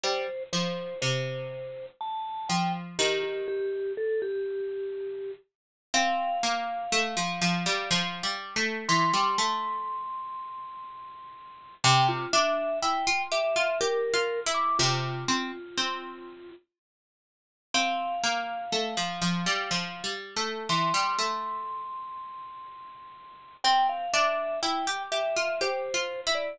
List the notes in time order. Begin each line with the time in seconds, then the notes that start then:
0.03 G3 C5
0.53 F3 C5
1.02 C3 C5
2.01 A5
2.49 F3 G5
2.99 D#3 G4
3.23 G4
3.48 G4
3.97 A4
4.22 G4
5.94 C4 F5
6.43 A#3
6.92 A3
7.17 F3
7.42 F3
7.66 G3
7.91 F3
8.23 G3
8.56 A3
8.89 E3 C6
9.14 G3
9.38 A3
11.84 C3 G5
12.09 F4
12.33 D4 E5
12.82 E4 G5
13.07 F4
13.32 G4 E5
13.56 F4
13.81 G4 A#4
14.14 F4
14.46 E4
14.54 D6
14.79 C3 F4
15.28 C4
15.77 C4
17.74 C4 F5
18.24 A#3
18.72 A3
18.97 F3
19.22 F3
19.46 G3
19.71 F3
20.04 G3
20.36 A3
20.69 E3 C6
20.94 G3
21.19 A3
23.64 C4 G5
23.89 F5
24.13 D4 E5
24.63 E4 G5
24.87 G4
25.12 G4 E5
25.36 F4
25.61 G4 C5
25.94 F4
26.27 E4
26.35 D5